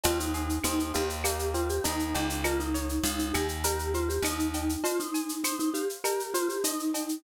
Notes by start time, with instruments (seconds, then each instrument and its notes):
0.04 electric bass (finger) D#2, acoustic guitar (steel) C4, vibraphone F4, cowbell, shaker
0.20 vibraphone D#4, shaker
0.34 acoustic guitar (steel) G#4, shaker
0.49 shaker
0.64 electric bass (finger) D#2, acoustic guitar (steel) C4, vibraphone D#4, claves, shaker
0.79 vibraphone D#4, shaker
0.94 electric bass (finger) D#2, acoustic guitar (steel) F4, vibraphone G4, shaker
1.09 shaker
1.24 acoustic guitar (steel) A#3, vibraphone G4, cowbell, claves, shaker
1.39 shaker
1.54 acoustic guitar (steel) C4, vibraphone F4, shaker
1.69 vibraphone G4, shaker
1.84 electric bass (finger) D#2, vibraphone D#4, acoustic guitar (steel) D#4, cowbell, shaker
1.99 shaker
2.14 electric bass (finger) C#2, acoustic guitar (steel) G4, cowbell, shaker
2.30 shaker
2.44 vibraphone F4, acoustic guitar (steel) A#4, cowbell, claves, shaker
2.59 vibraphone D#4, shaker
2.74 acoustic guitar (steel) C#5, shaker
2.89 shaker
3.04 electric bass (finger) C#2, vibraphone D#4, acoustic guitar (steel) F5, shaker
3.19 vibraphone D#4, shaker
3.33 electric bass (finger) D#2, vibraphone G4, acoustic guitar (steel) G#5, claves, shaker
3.48 shaker
3.64 vibraphone G4, acoustic guitar (steel) A#4, cowbell, shaker
3.79 shaker
3.94 vibraphone F4, acoustic guitar (steel) C5, shaker
4.08 vibraphone G4, shaker
4.22 electric bass (finger) D#2, vibraphone D#4, acoustic guitar (steel) D#5, cowbell, claves, shaker
4.39 shaker
4.54 acoustic guitar (steel) G5, cowbell, shaker
4.69 shaker
4.83 vibraphone F4, acoustic guitar (steel) C5, cowbell, shaker
4.99 vibraphone D#4, shaker
5.14 acoustic guitar (steel) G#5, shaker
5.29 shaker
5.44 vibraphone D#4, acoustic guitar (steel) C5, claves, shaker
5.59 vibraphone D#4, shaker
5.74 vibraphone G4, acoustic guitar (steel) F5, shaker
5.89 shaker
6.04 vibraphone G4, acoustic guitar (steel) A#4, cowbell, claves, shaker
6.20 shaker
6.34 vibraphone F4, acoustic guitar (steel) C5, shaker
6.48 vibraphone G4, shaker
6.64 vibraphone D#4, acoustic guitar (steel) D#5, cowbell, shaker
6.79 shaker
6.94 acoustic guitar (steel) G5, cowbell, shaker
7.09 shaker